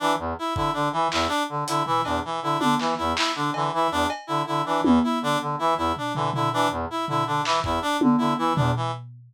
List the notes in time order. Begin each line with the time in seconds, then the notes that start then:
0.00 E3 D4
0.19 E2
0.39 E4
0.55 D3 E4, kick
0.73 D3 D4
0.92 E3
1.11 E2 E4, clap
1.28 D4
1.49 D3
1.68 D3 E4, closed hi-hat
1.86 E3 E4, floor tom
2.04 E2 D4, cowbell
2.25 E3
2.42 D3 E4
2.60 D3 D4, high tom
2.80 E3, clap
2.98 E2 E4
3.17 E4, clap
3.36 D3 D4
3.54 D3 E3, cowbell
3.73 E3 E4
3.91 E2 D4
4.10 cowbell
4.27 D3 E4
4.47 D3 E4
4.66 E3 D4
4.84 E2 E3, high tom
5.04 E4
5.22 D3 D4
5.41 D3
5.59 E3 E4
5.77 E2 E4
5.96 D4, floor tom
6.15 D3 E3, floor tom
6.34 D3 E4, floor tom
6.53 E3 D4
6.71 E2
6.90 E4
7.08 D3 E4, floor tom
7.26 D3 D4
7.45 E3, clap
7.64 E2 E4, kick
7.82 D4
8.01 D3, high tom
8.18 D3 E4
8.38 E3 E4
8.56 E2 D4, floor tom
8.76 E3